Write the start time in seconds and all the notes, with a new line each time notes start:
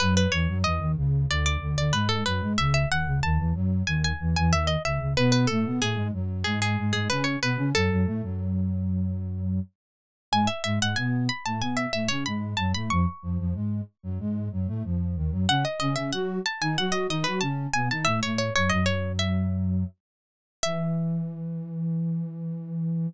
0.00 F#2 F#3 B4
0.17 B4
0.32 E2 E3 C#5
0.48 F#2 F#3
0.64 E2 E3 D#5
0.80 D#2 D#3
0.97 C#2 C#3
1.30 D2 D3 D5
1.46 D5
1.61 D2 D3
1.77 D2 D3 D5
1.92 G#2 G#3 B4
2.09 A4
2.26 F#2 F#3 B4
2.41 G#2 G#3
2.58 C#2 C#3 E5
2.74 E5
2.90 D#2 D#3 F#5
3.06 C#2 C#3
3.23 D#2 D#3 A5
3.38 E2 E3
3.54 F#2 F#3
3.87 D#2 D#3 G#5
4.04 G#5
4.20 E2 E3
4.36 E2 E3 G#5
4.50 D#2 D#3 E5
4.67 D#5
4.85 C#2 C#3 E5
5.00 C#2 C#3
5.16 B2 B3 B4
5.32 B4
5.47 A2 A3 A4
5.65 B2 B3
5.81 A2 A3 G#4
5.96 G#2 G#3
6.13 F#2 F#3
6.44 G#2 G#3 G#4
6.62 G#4
6.78 G#2 G#3
6.93 G#2 G#3 G#4
7.10 C#3 C#4 B4
7.24 C#5
7.42 B2 B3 B4
7.57 C#3 C#4
7.75 F#2 F#3 A4
7.90 F#2 F#3
8.06 A2 A3
8.23 F#2 F#3
10.32 G#2 G#3 G#5
10.47 E5
10.64 G#2 G#3 E5
10.80 G#2 G#3 F#5
10.96 B2 B3 G#5
11.29 B5
11.46 A2 A3 A5
11.60 B2 B3 G#5
11.77 E5
11.93 A2 A3 E5
12.08 C#3 C#4 C#5
12.26 G#2 G#3 B5
12.57 F#2 F#3 A5
12.74 A2 A3 B5
12.90 F2 F3 C#6
13.22 F2 F3
13.39 F2 F3
13.54 G#2 G#3
14.03 F#2 F#3
14.19 G#2 G#3
14.52 F#2 F#3
14.67 A2 A3
14.84 F2 F3
15.16 D#2 D#3
15.31 F#2 F#3
15.49 C#3 C#4 F#5
15.65 D#5
15.80 C#3 C#4 D#5
15.96 C#3 C#4 E5
16.12 F#3 F#4 F#5
16.46 A5
16.61 D#3 D#4 G#5
16.78 F#3 F#4 F#5
16.92 D#5
17.09 D#3 D#4 D#5
17.24 F#3 F#4 B4
17.41 C#3 C#4 A5
17.74 B2 B3 G#5
17.91 D#3 D#4 A5
18.05 A2 A3 E5
18.23 A2 A3 C#5
18.38 C#5
18.56 F#2 F#3 C#5
18.69 F#2 F#3 D#5
18.86 C#5
19.19 E5
20.63 E3 E5